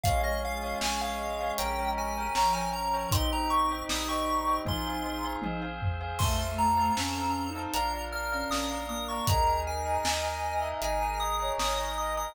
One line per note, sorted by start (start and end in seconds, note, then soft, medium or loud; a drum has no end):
0.04 0.73 A#1 medium
0.04 2.24 G#3 loud
0.04 0.81 C#4 loud
0.04 0.81 F4 loud
0.04 0.81 G#4 medium
0.04 0.21 C#5 loud
0.04 0.22 F5 medium
0.04 0.21 F5 loud
0.04 0.21 G#5 medium
0.04 kick loud
0.04 closed hi-hat loud
0.24 0.55 C#5 medium
0.24 0.42 D#5 medium
0.24 0.55 F5 medium
0.24 0.55 G#5 medium
0.45 0.79 F5 medium
0.63 0.94 C#5 medium
0.63 0.94 F5 medium
0.63 0.94 G#5 medium
0.81 1.51 A#1 medium
0.81 1.58 C#4 loud
0.81 1.58 G#4 loud
0.81 1.58 C#5 medium
0.81 1.02 G#5 medium
0.81 snare loud
1.01 1.32 C#5 medium
1.01 1.52 F5 medium
1.01 1.32 F5 medium
1.01 1.32 G#5 medium
1.41 1.56 C#5 medium
1.41 1.56 F5 medium
1.41 1.56 G#5 medium
1.58 2.28 A#1 medium
1.58 2.35 C#4 medium
1.58 2.35 G4 medium
1.58 2.35 A#4 loud
1.58 1.74 C#5 loud
1.58 1.74 G5 loud
1.58 1.91 G5 medium
1.58 1.74 A#5 medium
1.58 closed hi-hat loud
1.78 1.93 C#5 medium
1.78 1.93 G5 medium
1.78 1.93 A#5 medium
1.97 2.13 C#5 medium
1.97 2.13 G5 medium
1.97 2.35 G#5 medium
1.97 2.13 A#5 medium
2.17 2.33 C#5 medium
2.17 2.33 G5 medium
2.17 2.33 A#5 medium
2.35 3.05 A#1 medium
2.35 3.09 F3 loud
2.35 3.11 C#4 medium
2.35 3.11 A#4 medium
2.35 3.11 C#5 medium
2.35 2.51 C#5 medium
2.35 2.51 G5 medium
2.35 2.54 A#5 medium
2.35 2.51 A#5 medium
2.35 snare loud
2.53 2.85 C#5 medium
2.53 2.85 G5 medium
2.53 2.71 G#5 medium
2.53 2.85 A#5 medium
2.73 3.10 A#5 medium
2.94 3.09 C#5 medium
2.94 3.09 G5 medium
2.94 3.09 A#5 medium
3.11 3.82 A#1 medium
3.11 3.88 C4 medium
3.11 5.65 D#4 loud
3.11 3.88 D#4 loud
3.11 3.88 G4 loud
3.11 3.28 C5 loud
3.11 3.28 D#5 loud
3.11 3.28 G5 medium
3.11 3.31 C6 medium
3.11 kick loud
3.11 closed hi-hat loud
3.32 3.63 C5 medium
3.32 3.63 D#5 medium
3.32 3.63 G5 medium
3.32 3.51 A#5 medium
3.50 3.83 C#6 medium
3.71 4.02 C5 medium
3.71 4.02 D#5 medium
3.71 4.02 G5 loud
3.89 4.58 A#1 medium
3.89 4.66 G3 loud
3.89 4.66 C4 loud
3.89 4.66 G4 loud
3.89 4.08 D#6 medium
3.89 snare loud
4.08 4.39 C5 medium
4.08 4.39 D#5 medium
4.08 4.39 G5 medium
4.08 4.60 C#6 medium
4.47 4.62 C5 medium
4.47 4.62 D#5 medium
4.47 4.62 G5 medium
4.65 5.35 A#1 medium
4.65 5.43 C4 medium
4.65 5.43 F4 loud
4.65 5.43 G#4 medium
4.65 4.82 C5 loud
4.65 4.82 F5 loud
4.65 4.82 G#5 loud
4.65 5.33 C6 medium
4.65 kick medium
4.65 high tom medium
4.87 5.02 C5 medium
4.87 5.02 F5 medium
4.87 5.02 G#5 medium
5.05 5.21 C5 medium
5.05 5.21 F5 medium
5.05 5.21 G#5 medium
5.24 5.40 C5 medium
5.24 5.40 F5 medium
5.24 5.40 G#5 medium
5.42 6.12 A#1 medium
5.42 6.20 C4 medium
5.42 6.20 G#4 loud
5.42 6.20 C5 medium
5.42 5.59 C5 medium
5.42 5.59 F5 medium
5.42 5.59 G#5 medium
5.42 high tom medium
5.62 5.93 C5 medium
5.62 5.93 F5 medium
5.62 5.93 G#5 medium
5.82 floor tom loud
6.01 6.16 C5 medium
6.01 6.16 F5 loud
6.01 6.16 G#5 medium
6.19 6.90 F2 medium
6.19 6.92 A3 loud
6.19 6.96 C4 medium
6.19 6.96 F4 medium
6.19 6.96 A4 medium
6.19 6.36 C5 loud
6.19 6.36 F5 medium
6.19 6.36 A5 medium
6.19 6.52 C6 medium
6.19 kick loud
6.19 crash loud
6.40 6.71 C5 medium
6.40 6.71 F5 medium
6.40 6.71 A5 medium
6.58 7.60 A#5 medium
6.77 7.08 C5 medium
6.77 7.08 F5 medium
6.77 7.08 A5 medium
6.96 7.67 F2 medium
6.96 7.73 C4 medium
6.96 7.21 C#4 medium
6.96 7.73 A4 loud
6.96 7.73 C5 medium
6.96 snare loud
7.16 7.47 C5 medium
7.16 7.47 F5 medium
7.16 7.47 A5 medium
7.23 7.48 C#4 medium
7.49 7.73 D#4 medium
7.55 7.71 C5 medium
7.55 7.71 F5 medium
7.55 7.71 A5 medium
7.74 8.43 A#1 medium
7.74 8.50 D4 medium
7.74 8.50 F4 medium
7.74 8.50 A#4 loud
7.74 7.89 D5 loud
7.74 7.89 F5 loud
7.74 7.89 A#5 loud
7.74 8.05 A#5 medium
7.74 closed hi-hat loud
7.93 8.09 D5 medium
7.93 8.09 F5 medium
7.93 8.09 A#5 medium
8.12 8.27 D5 medium
8.12 8.27 F5 medium
8.12 8.27 A#5 medium
8.12 8.50 F6 medium
8.32 8.81 C#4 medium
8.32 8.48 D5 medium
8.32 8.48 F5 medium
8.32 8.48 A#5 medium
8.50 9.19 A#1 medium
8.50 9.27 A#3 loud
8.50 9.27 D4 medium
8.50 9.27 A#4 loud
8.50 8.66 D5 medium
8.50 8.66 F5 medium
8.50 8.66 A#5 medium
8.50 8.87 D#6 medium
8.50 snare loud
8.71 9.01 D5 medium
8.71 9.01 F5 medium
8.71 9.01 A#5 medium
8.88 9.26 A#3 medium
8.88 9.07 D#6 medium
9.08 9.25 D5 medium
9.08 9.25 F5 medium
9.08 9.25 A#5 medium
9.08 9.27 C#6 medium
9.27 9.98 D#2 medium
9.27 10.04 D#4 loud
9.27 10.04 G#4 loud
9.27 10.04 A#4 medium
9.27 9.95 A#4 medium
9.27 9.43 D#5 loud
9.27 9.43 G#5 loud
9.27 9.43 A#5 loud
9.27 9.61 A#5 medium
9.27 kick loud
9.27 closed hi-hat loud
9.47 9.78 D#5 medium
9.47 9.78 G#5 medium
9.47 9.78 A#5 medium
9.67 10.68 G#5 medium
9.85 10.16 D#5 medium
9.85 10.16 G#5 medium
9.85 10.16 A#5 medium
10.04 10.73 D#2 medium
10.04 10.81 D#4 medium
10.04 10.81 A#4 loud
10.04 10.81 D#5 medium
10.04 10.29 D#5 medium
10.04 snare loud
10.23 10.54 D#5 medium
10.23 10.54 G#5 medium
10.23 10.54 A#5 medium
10.31 10.55 D#5 medium
10.55 10.80 E5 medium
10.62 10.77 D#5 medium
10.62 10.77 G#5 medium
10.62 10.77 A#5 medium
10.82 11.51 G#1 medium
10.82 11.58 D#4 medium
10.82 11.58 G#4 loud
10.82 11.58 A#4 loud
10.82 10.98 D#5 loud
10.82 10.98 G#5 medium
10.82 11.20 G#5 medium
10.82 10.98 A#5 medium
10.82 closed hi-hat medium
11.01 11.16 D#5 medium
11.01 11.16 G#5 medium
11.01 11.16 A#5 medium
11.20 11.36 D#5 medium
11.20 11.36 G#5 medium
11.20 11.36 A#5 medium
11.20 11.53 D#6 medium
11.40 11.88 C#5 medium
11.40 11.55 D#5 medium
11.40 11.55 G#5 medium
11.40 11.55 A#5 medium
11.58 12.28 G#1 medium
11.58 12.35 D#4 medium
11.58 12.35 A#4 loud
11.58 11.74 D#5 medium
11.58 12.35 D#5 loud
11.58 11.74 G#5 medium
11.58 11.74 A#5 medium
11.58 11.96 D#6 medium
11.58 snare loud
11.77 12.08 D#5 medium
11.77 12.08 G#5 medium
11.77 12.08 A#5 medium
11.96 12.28 D#5 medium
11.96 12.16 D#6 medium
12.17 12.33 D#5 medium
12.17 12.33 G#5 medium
12.17 12.33 A#5 medium
12.17 12.35 D#6 medium